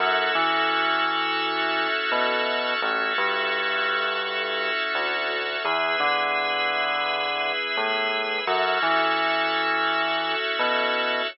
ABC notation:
X:1
M:4/4
L:1/8
Q:"Swing 16ths" 1/4=85
K:F#m
V:1 name="Drawbar Organ"
[CEFA]8 | [CEFA]8 | [B,EG]8 | [CEFA]8 |]
V:2 name="Drawbar Organ"
[FAce]8 | [FAce]8 | [GBe]8 | [FAce]8 |]
V:3 name="Synth Bass 1" clef=bass
F,, E,5 B,,2 | A,,, =G,,5 D,,2 | E,, D,5 A,,2 | F,, E,5 B,,2 |]